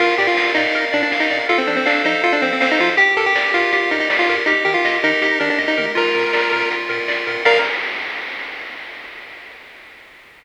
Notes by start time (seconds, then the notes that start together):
0.00 A#1 F4 A#4, kick, crash
0.18 A#2 G4 D5, snare, open hi-hat
0.27 F4
0.37 A#1 F5, kick, snare
0.55 A#2 D#4 D5, open hi-hat
0.75 A#1 A#4, kick, closed hi-hat
0.92 A#2 D4 D5, open hi-hat
1.03 D4
1.12 A#1 F5, kick, snare
1.20 D#4
1.30 A#2 D5, open hi-hat
1.49 F2 F4 A4, kick, closed hi-hat
1.58 C4
1.67 F3 D4 C5, snare, open hi-hat
1.76 C4
1.85 F2 D4 F5, kick, clap
2.05 F3 D#4 C5, open hi-hat
2.23 F2 F4 A4, kick, closed hi-hat
2.33 D4
2.42 F3 C4 C5, open hi-hat
2.53 C4
2.60 F2 C4 F5, kick, snare
2.71 D#4
2.79 F3 F4 C5, open hi-hat
2.97 G1 G4, kick, closed hi-hat
3.17 G2 A4 A#4, snare, open hi-hat
3.26 G4
3.35 G1 D5, kick, snare
3.54 G2 F4 A#4, open hi-hat
3.72 G1 G4, kick, closed hi-hat
3.91 G2 D#4 A#4, open hi-hat
4.00 D#4
4.10 G1 D5, kick, snare
4.19 F4
4.28 G2 A#4, open hi-hat
4.46 D#2 D#4 G4, kick, closed hi-hat
4.65 D#3 G4 A#4, snare, open hi-hat
4.74 F4
4.84 D#2 D#5, kick, clap
5.03 D#3 D#4 A#4, open hi-hat
5.22 D#2 G4, kick, closed hi-hat
5.40 D#3 D4 A#4, open hi-hat
5.50 D4
5.58 D#2 D#5, kick, snare
5.68 D#4
5.78 D#3 A#4, mid tom
5.95 A#1 F4 A#4, kick, crash
6.15 A#2 A#4, snare, open hi-hat
6.33 A#1 D5, kick, snare
6.52 A#2 A#4, open hi-hat
6.71 A#1 F4, kick, closed hi-hat
6.89 A#2 A#4, open hi-hat
7.08 A#1 D5, kick, clap
7.27 A#2 A#4, open hi-hat
7.45 A#1 A#4 D5 F5, kick, crash